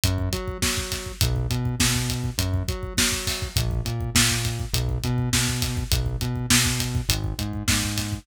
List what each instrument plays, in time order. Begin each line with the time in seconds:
0.04 synth bass 1 F#2, kick, closed hi-hat
0.18 kick
0.33 synth bass 1 F#3, kick, closed hi-hat
0.48 kick
0.62 synth bass 1 F#3, kick, snare
0.77 kick
0.92 kick, snare, closed hi-hat
1.06 kick
1.21 synth bass 1 B1, kick, closed hi-hat
1.36 kick
1.50 synth bass 1 B2, kick, closed hi-hat
1.65 kick
1.80 synth bass 1 B2, kick, snare
1.95 kick
2.10 kick, closed hi-hat
2.24 kick
2.38 synth bass 1 F#2, kick, closed hi-hat
2.54 kick
2.68 synth bass 1 F#3, kick, closed hi-hat
2.83 kick
2.97 synth bass 1 F#3, kick, snare
3.12 kick
3.27 kick, snare, open hi-hat
3.42 kick
3.56 synth bass 1 A#1, kick, closed hi-hat
3.71 kick
3.85 synth bass 1 A#2, kick, closed hi-hat
4.01 kick
4.15 synth bass 1 A#2, kick, snare
4.30 kick
4.45 kick, closed hi-hat
4.60 kick
4.73 synth bass 1 B1, kick, closed hi-hat
4.89 kick
5.04 synth bass 1 B2, kick, closed hi-hat
5.18 kick
5.33 synth bass 1 B2, kick, snare
5.48 kick
5.62 kick, snare, closed hi-hat
5.77 kick
5.92 synth bass 1 B1, kick, closed hi-hat
6.06 kick
6.21 synth bass 1 B2, kick, closed hi-hat
6.36 kick
6.50 synth bass 1 B2, kick, snare
6.65 kick
6.80 kick, closed hi-hat
6.95 kick
7.09 synth bass 1 G#1, kick, closed hi-hat
7.24 kick
7.38 synth bass 1 G#2, kick, closed hi-hat
7.53 kick
7.68 synth bass 1 G#2, kick, snare
7.83 kick
7.98 kick, snare, closed hi-hat
8.12 kick